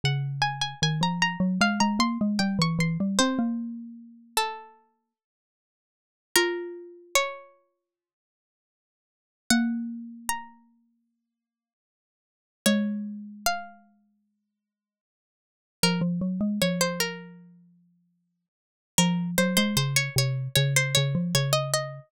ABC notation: X:1
M:4/4
L:1/16
Q:1/4=76
K:Bbm
V:1 name="Pizzicato Strings"
g2 a a a b b2 f b c'2 =g d' c'2 | c4 z2 =A6 z4 | B4 d8 z4 | g4 b8 z4 |
d4 f8 z4 | B z3 d c B6 z4 | B2 c c c d d2 d c d2 d e e2 |]
V:2 name="Xylophone"
D,4 E, F,2 G, A, A, B, A, =G, =E, E, G, | C B,9 z6 | F16 | B,16 |
A,16 | F, F, G, A, F,10 z2 | F,2 G, A, D,2 C,2 D,2 D, F, D,4 |]